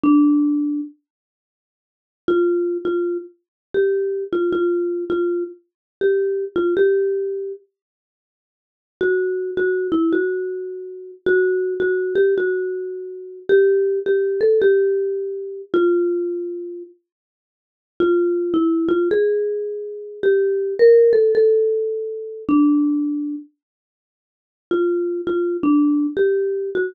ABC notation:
X:1
M:4/4
L:1/8
Q:"Swing" 1/4=107
K:Dm
V:1 name="Marimba"
D3 z5 | F2 F z2 G2 F | F2 F z2 G2 F | G3 z5 |
[K:D] F2 F E F4 | F2 F G F4 | G2 G A G4 | =F4 z4 |
[K:Dm] F2 E F ^G4 | G2 B A A4 | D3 z5 | F2 F D2 G2 _G |]